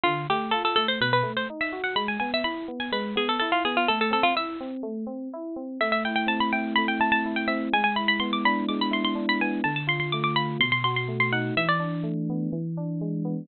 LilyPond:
<<
  \new Staff \with { instrumentName = "Harpsichord" } { \time 4/4 \key a \minor \tempo 4 = 125 f'8 g'8 a'16 a'16 a'16 c''16 b'16 b'8 c''16 r16 e''8 fis''16 | b''16 gis''16 gis''16 e''16 b''8. gis''16 b'8 gis'16 a'16 a'16 f'16 gis'16 f'16 | a'16 a'16 a'16 f'16 e''2 r4 | e''16 e''16 g''16 g''16 a''16 b''16 g''8 b''16 g''16 a''16 a''8 g''16 e''8 |
gis''16 gis''16 b''16 b''16 c'''16 d'''16 b''8 d'''16 b''16 c'''16 c'''8 b''16 gis''8 | a''16 a''16 c'''16 c'''16 d'''16 d'''16 b''8 c'''16 c'''16 c'''16 c'''8 c'''16 fis''8 | e''16 d''2~ d''16 r4. | }
  \new Staff \with { instrumentName = "Electric Piano 2" } { \time 4/4 \key a \minor d8 a8 f'8 a8 b,8 a8 dis'8 fis'8 | gis8 b8 e'8 b8 gis8 b8 e'8 b8 | a8 c'8 e'8 c'8 a8 c'8 e'8 c'8 | a8 e'8 c'8 e'8 a8 e'8 e'8 c'8 |
gis8 e'8 b8 d'8 gis8 e'8 d'8 b8 | d8 f'8 a8 f'8 b,8 fis'8 a8 dis'8 | e8 d'8 a8 b8 e8 d'8 gis8 b8 | }
>>